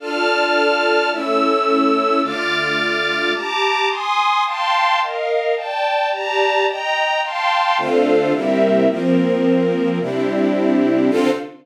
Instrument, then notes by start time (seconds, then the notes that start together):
string ensemble 1
0.00 D4 F4 A4 D5 A5 F6
1.11 A3 C#4 E4 A4 C#5 E6
2.22 D3 A3 F4 D6 F6 A6
3.34 G4 A5 A#5 D6
3.89 G#5 C6 D#6
4.45 F5 G5 A5 C6
5.00 A#4 D#5 F5
5.56 D5 G5 A5
6.11 G4 D5 A5 A#5
6.66 D#5 G5 A#5
7.23 F5 G5 A5 C6
7.78 D3 A3 C4 D4 F4 A4 C5 F5
8.33 C3 G3 A#3 C4 E4 G4 A#4 E5
8.89 F3 A#3 C4 A#4
10.00 C3 G3 C4 D4 E4 G4
11.10 D3 C4 D4 F4 A4 C5 F5